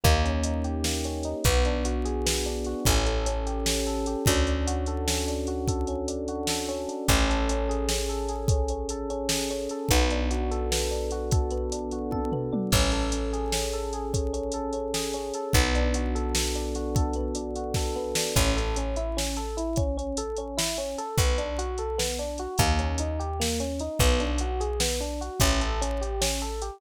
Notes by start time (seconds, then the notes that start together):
0.04 D#2 A#3, kick, closed hi-hat
0.24 C#4, closed hi-hat
0.43 D#4, closed hi-hat
0.64 G4, closed hi-hat
0.84 A#3, snare
1.04 C#4, closed hi-hat
1.23 D#4, closed hi-hat
1.44 B1 B3, kick, closed hi-hat
1.65 D4, closed hi-hat
1.85 F#4, closed hi-hat
2.05 G#4, closed hi-hat
2.26 B3, snare
2.45 D4, closed hi-hat
2.64 F#4, closed hi-hat
2.85 A1 C#4, kick, closed hi-hat
3.06 A4, closed hi-hat
3.26 C#4, closed hi-hat
3.46 G4, closed hi-hat
3.66 C#4, snare
3.86 A4, closed hi-hat
4.06 G4, closed hi-hat
4.26 D2 C#4, kick, closed hi-hat
4.47 D4, closed hi-hat
4.67 F#4, closed hi-hat
4.86 A4, closed hi-hat
5.08 C#4, snare
5.28 D4, closed hi-hat
5.47 F#4, closed hi-hat
5.68 A4, kick, closed hi-hat
5.87 C#4, closed hi-hat
6.08 D4, closed hi-hat
6.28 F#4, closed hi-hat
6.47 A4, snare
6.68 C#4, closed hi-hat
6.88 D4, closed hi-hat
7.08 A1 C#4, kick, closed hi-hat
7.29 A4, closed hi-hat
7.49 C#4, closed hi-hat
7.69 G#4, closed hi-hat
7.89 C#4, snare
8.09 A4, closed hi-hat
8.29 G#4, closed hi-hat
8.48 C#4, kick, closed hi-hat
8.68 C#4, closed hi-hat
8.89 A4, closed hi-hat
9.10 C#4, closed hi-hat
9.29 G#4, snare
9.50 C#4, closed hi-hat
9.69 A4, closed hi-hat
9.89 B1 B3, kick, closed hi-hat
10.10 D4, closed hi-hat
10.31 F#4, closed hi-hat
10.51 A4, closed hi-hat
10.71 B3, snare
10.91 D4, closed hi-hat
11.11 F#4, closed hi-hat
11.31 A4, kick, closed hi-hat
11.51 B3, closed hi-hat
11.72 D4, closed hi-hat
11.91 F#4, closed hi-hat
12.11 A4, kick, high tom
12.32 B3, floor tom
12.52 D4, mid tom
12.72 A1 C#4, kick, crash
12.92 A4, closed hi-hat
13.12 C#4, closed hi-hat
13.33 G#4, closed hi-hat
13.52 C#4, snare
13.73 A4, closed hi-hat
13.93 G#4, closed hi-hat
14.13 C#4, kick, closed hi-hat
14.33 C#4, closed hi-hat
14.52 A4, closed hi-hat
14.73 C#4, closed hi-hat
14.94 G#4, snare
15.13 C#4, closed hi-hat
15.34 A4, closed hi-hat
15.53 B1 B3, kick, closed hi-hat
15.75 D4, closed hi-hat
15.94 F#4, closed hi-hat
16.15 A4, closed hi-hat
16.35 B3, snare
16.55 D4, closed hi-hat
16.75 F#4, closed hi-hat
16.95 A4, kick, closed hi-hat
17.13 B3, closed hi-hat
17.35 D4, closed hi-hat
17.56 F#4, closed hi-hat
17.74 A4, kick, snare
17.96 B3
18.15 D4, snare
18.36 A1 C#4, kick, closed hi-hat
18.56 A4, closed hi-hat
18.76 C#4, closed hi-hat
18.96 E4, closed hi-hat
19.17 C#4, snare
19.36 A4, closed hi-hat
19.57 E4, closed hi-hat
19.76 C#4, kick, closed hi-hat
19.97 C#4, closed hi-hat
20.17 A4, closed hi-hat
20.36 C#4, closed hi-hat
20.57 E4, snare
20.77 C#4, closed hi-hat
20.98 A4, closed hi-hat
21.18 B1 B3, kick, closed hi-hat
21.38 D4, closed hi-hat
21.58 F#4, closed hi-hat
21.78 A4, closed hi-hat
21.98 B3, snare
22.19 D4, closed hi-hat
22.38 F#4, closed hi-hat
22.58 D#2 A#3, kick, closed hi-hat
22.79 C#4, closed hi-hat
22.98 D#4, closed hi-hat
23.19 G4, closed hi-hat
23.40 A#3, snare
23.60 C#4, closed hi-hat
23.79 D#4, closed hi-hat
23.99 B1 B3, kick, closed hi-hat
24.20 D4, closed hi-hat
24.38 F#4, closed hi-hat
24.60 G#4, closed hi-hat
24.80 B3, snare
25.00 D4, closed hi-hat
25.21 F#4, closed hi-hat
25.40 A1 C#4, kick, closed hi-hat
25.61 A4, closed hi-hat
25.81 C#4, closed hi-hat
26.01 G4, closed hi-hat
26.21 C#4, snare
26.40 A4, closed hi-hat
26.62 G4, closed hi-hat